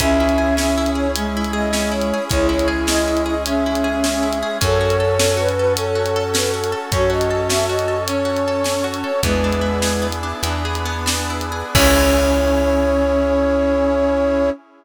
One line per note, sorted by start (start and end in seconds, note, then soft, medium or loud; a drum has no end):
0.00 2.13 C#2 medium
0.00 0.17 C#4 medium
0.00 2.29 C#4 medium
0.00 1.08 C#4 loud
0.00 2.29 E4 medium
0.00 2.29 G#4 medium
0.00 0.56 E5 medium
0.00 kick medium
0.00 closed hi-hat medium
0.20 0.37 E4 medium
0.29 closed hi-hat medium
0.38 0.55 G#4 medium
0.57 0.74 C#4 medium
0.57 0.91 E5 medium
0.57 snare medium
0.77 0.95 E4 medium
0.86 closed hi-hat medium
0.95 1.12 G#4 medium
0.95 1.11 C#5 medium
1.15 2.19 G#3 loud
1.15 1.33 C#4 medium
1.15 closed hi-hat medium
1.37 1.54 E4 medium
1.44 closed hi-hat medium
1.53 1.70 G#4 medium
1.53 1.91 D#5 medium
1.73 1.90 C#4 medium
1.73 snare medium
1.92 2.09 E4 medium
1.92 2.24 C#5 medium
2.02 closed hi-hat medium
2.13 2.31 G#4 medium
2.29 4.43 C#2 medium
2.29 4.59 G#3 medium
2.29 2.47 C#4 medium
2.29 4.59 C#4 medium
2.29 3.34 E4 loud
2.29 4.59 G#4 medium
2.29 2.47 C#5 medium
2.29 kick medium
2.29 closed hi-hat medium
2.49 2.66 E4 medium
2.49 2.67 C#5 medium
2.59 closed hi-hat medium
2.68 2.85 G#4 medium
2.87 3.04 C#4 medium
2.87 3.23 D#5 medium
2.87 snare medium
3.08 3.25 E4 medium
3.17 closed hi-hat medium
3.26 3.43 G#4 medium
3.26 3.43 D#5 medium
3.46 4.38 C#4 loud
3.46 3.64 C#4 medium
3.46 4.57 E5 medium
3.46 closed hi-hat medium
3.66 3.83 E4 medium
3.75 closed hi-hat medium
3.84 4.01 G#4 medium
4.04 4.23 C#4 medium
4.04 snare medium
4.23 4.40 E4 medium
4.33 closed hi-hat medium
4.43 4.60 G#4 medium
4.61 6.74 F#2 loud
4.61 4.78 C#4 medium
4.61 6.90 C#4 medium
4.61 6.90 F#4 medium
4.61 6.90 A4 medium
4.61 5.36 A4 loud
4.61 5.48 C#5 medium
4.61 kick medium
4.61 closed hi-hat medium
4.81 4.98 F#4 medium
4.90 closed hi-hat medium
5.00 5.17 A4 medium
5.19 5.37 C#4 medium
5.19 snare loud
5.37 5.54 F#4 medium
5.37 5.73 B4 medium
5.49 closed hi-hat medium
5.58 5.77 A4 medium
5.58 5.73 B4 medium
5.76 5.95 C#4 medium
5.76 6.79 A4 medium
5.76 6.24 C#5 medium
5.76 closed hi-hat medium
5.95 6.12 F#4 medium
6.06 closed hi-hat medium
6.16 6.33 A4 medium
6.34 6.51 C#4 medium
6.34 6.51 B4 medium
6.34 snare loud
6.54 6.71 F#4 medium
6.64 closed hi-hat medium
6.72 6.89 A4 medium
6.92 9.04 F#2 medium
6.92 9.21 C#4 medium
6.92 7.11 C#4 medium
6.92 7.98 F#4 medium
6.92 9.21 A4 medium
6.92 9.21 C#5 medium
6.92 7.10 C#5 medium
6.92 kick medium
6.92 closed hi-hat medium
7.10 7.27 F#4 medium
7.10 7.48 D#5 medium
7.21 closed hi-hat medium
7.30 7.48 A4 medium
7.49 7.67 C#4 medium
7.49 7.65 E5 medium
7.49 snare medium
7.69 7.86 F#4 medium
7.69 8.04 D#5 medium
7.79 closed hi-hat medium
7.88 8.05 A4 medium
8.07 9.12 C#4 medium
8.07 8.27 C#4 medium
8.07 8.86 C#5 medium
8.07 closed hi-hat medium
8.25 8.42 F#4 medium
8.37 closed hi-hat medium
8.48 8.65 A4 medium
8.64 8.81 C#4 medium
8.64 snare medium
8.84 9.01 F#4 medium
8.94 closed hi-hat medium
9.04 9.21 A4 medium
9.04 9.21 C#5 medium
9.23 10.33 E2 loud
9.23 10.07 G#3 medium
9.23 10.42 B3 medium
9.23 9.41 B3 medium
9.23 10.42 D4 medium
9.23 10.42 E4 medium
9.23 10.42 G#4 medium
9.23 10.07 B4 medium
9.23 kick medium
9.23 closed hi-hat medium
9.44 9.62 D4 medium
9.53 closed hi-hat medium
9.61 9.79 E4 medium
9.82 10.00 G#4 medium
9.82 snare medium
10.02 10.20 B3 medium
10.12 closed hi-hat medium
10.23 10.42 D4 medium
10.43 11.63 E2 medium
10.43 11.74 B3 medium
10.43 11.74 D4 medium
10.43 10.62 E4 medium
10.43 11.74 G#4 medium
10.43 11.74 B4 medium
10.43 closed hi-hat medium
10.65 10.84 G#4 medium
10.75 closed hi-hat medium
10.85 11.05 B3 medium
11.06 11.26 D4 medium
11.06 snare loud
11.30 11.50 E4 medium
11.41 closed hi-hat medium
11.52 11.72 G#4 medium
11.74 14.50 C#2 loud
11.74 14.50 C#4 loud
11.74 14.51 C#4 loud
11.74 14.50 E4 loud
11.74 14.50 G#4 medium
11.74 14.50 G#4 loud
11.74 14.50 C#5 loud
11.74 kick loud
11.74 crash loud